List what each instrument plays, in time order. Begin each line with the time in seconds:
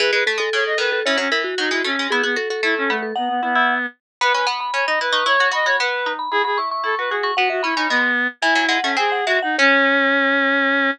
0.00 harpsichord E3, vibraphone G#4, clarinet B4
0.12 harpsichord G#3, vibraphone G#4, clarinet B4
0.26 harpsichord A3, vibraphone A4
0.38 harpsichord G#3, vibraphone A4
0.53 harpsichord C#3, clarinet C#5
0.66 clarinet D#5
0.78 harpsichord D#3, clarinet B4
0.92 vibraphone A4
1.05 harpsichord E3, clarinet C#4, vibraphone C#5
1.17 harpsichord F#3, clarinet C#4, vibraphone C#5
1.32 harpsichord E3, vibraphone A#4
1.44 vibraphone F#4
1.58 harpsichord F#3, clarinet D#4
1.70 harpsichord G#3, clarinet E4
1.84 harpsichord A3, clarinet C#4
1.99 harpsichord G#3
2.10 clarinet B3, harpsichord E4, vibraphone G#4
2.23 clarinet B3, harpsichord F#4, vibraphone G#4
2.36 harpsichord F#4, vibraphone A4
2.50 harpsichord F#4, vibraphone A4
2.63 harpsichord A3, clarinet E4
2.78 clarinet C#4
2.89 clarinet A3, harpsichord B3
3.02 vibraphone A4
3.16 clarinet B3, harpsichord D#4, vibraphone F#5
3.29 clarinet B3
3.43 clarinet B3, harpsichord E4
3.55 harpsichord E4
4.21 harpsichord B3, clarinet B4, vibraphone B5
4.34 harpsichord C#4, clarinet B4, vibraphone B5
4.47 harpsichord B3, vibraphone B5
4.60 vibraphone B5
4.74 harpsichord C#4, clarinet C#5
4.87 harpsichord D#4, clarinet D#5
5.01 harpsichord E4, clarinet B4
5.13 harpsichord D#4, vibraphone C#6
5.26 harpsichord E4, clarinet C#5, vibraphone C#6
5.40 harpsichord F#4, vibraphone C#6
5.52 harpsichord F#4, clarinet D#5, vibraphone B5
5.66 harpsichord F#4, clarinet C#5, vibraphone B5
5.79 harpsichord B3, clarinet B4
6.06 harpsichord D#4
6.19 vibraphone B5
6.31 harpsichord E4, clarinet G#4, vibraphone B5
6.44 harpsichord F#4, clarinet G#4, vibraphone B5
6.58 harpsichord E4, vibraphone C#6
6.71 vibraphone C#6
6.84 harpsichord E4, clarinet A4
6.98 harpsichord F#4, clarinet B4
7.10 harpsichord F#4, clarinet G#4
7.23 harpsichord F#4, vibraphone C#6
7.36 harpsichord B3, clarinet F#4, vibraphone F#5
7.50 clarinet F#4, vibraphone E5
7.63 harpsichord C#4, clarinet E4, vibraphone B5
7.75 harpsichord C#4, clarinet D#4
7.89 harpsichord G#3, clarinet B3
8.42 harpsichord E3, clarinet E4, vibraphone G#5
8.55 harpsichord F#3
8.69 harpsichord G#3, vibraphone F#5
8.83 harpsichord A3, clarinet C#4
8.97 harpsichord C4, clarinet G#4, vibraphone G#5
9.12 vibraphone F#5
9.26 harpsichord G#3, clarinet F#4, vibraphone E5
9.42 clarinet D#4, vibraphone F#5
9.58 clarinet C#4, harpsichord C#4, vibraphone C#5